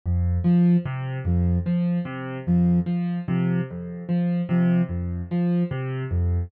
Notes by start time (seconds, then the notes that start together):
0.06 F2
0.44 F3
0.85 C3
1.25 F2 F3
1.66 F3
2.05 C3
2.47 F2 F3
2.86 F3
3.28 C3 F3
3.71 F2
4.09 F3
4.49 C3 F3
4.89 F2
5.31 F3
5.71 C3
6.11 F2